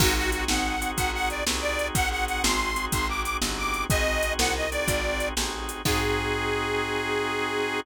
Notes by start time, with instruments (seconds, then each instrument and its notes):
0.00 electric bass (finger) G#1, drawbar organ C4 D#4 F#4 G#4, harmonica F#4, kick, crash
0.16 drawbar organ C4 D#4 F#4 G#4, harmonica F#4
0.32 harmonica F#4, closed hi-hat
0.48 electric bass (finger) G#1, harmonica F#5, snare
0.81 drawbar organ C4 D#4 F#4 G#4, closed hi-hat
0.97 electric bass (finger) G#1, harmonica F#5, kick, closed hi-hat
1.13 drawbar organ C4 D#4 F#4 G#4, harmonica F#5
1.30 harmonica D5, closed hi-hat
1.46 electric bass (finger) C2, drawbar organ C4 D#4 F#4 G#4, snare
1.61 harmonica D5
1.79 closed hi-hat
1.95 electric bass (finger) G#1, harmonica F#5, kick, closed hi-hat
2.11 drawbar organ C4 D#4 F#4 G#4, harmonica F#5
2.27 harmonica F#5, closed hi-hat
2.43 electric bass (finger) G#1, harmonica C6, snare
2.76 drawbar organ C4 D#4 F#4 G#4, closed hi-hat
2.92 electric bass (finger) G#1, harmonica C6, kick, closed hi-hat
3.09 drawbar organ C4 D#4 F#4 G#4, harmonica D6
3.24 harmonica D6, closed hi-hat
3.42 electric bass (finger) G1, drawbar organ C4 D#4 F#4 G#4, snare
3.58 harmonica D6
3.74 closed hi-hat
3.90 electric bass (finger) G#1, drawbar organ C4 D#4 F#4 G#4, harmonica D#5, kick, closed hi-hat
4.06 drawbar organ C4 D#4 F#4 G#4
4.23 closed hi-hat
4.38 electric bass (finger) C2, harmonica F#5, snare
4.56 harmonica D#5
4.71 drawbar organ C4 D#4 F#4 G#4, harmonica D5, closed hi-hat
4.88 electric bass (finger) G#1, kick, closed hi-hat
5.04 drawbar organ C4 D#4 F#4 G#4
5.20 closed hi-hat
5.37 electric bass (finger) A1, drawbar organ C4 D#4 F#4 G#4, snare
5.69 closed hi-hat
5.85 electric bass (finger) G#2, drawbar organ C4 D#4 F#4 G#4, harmonica G#4, kick, crash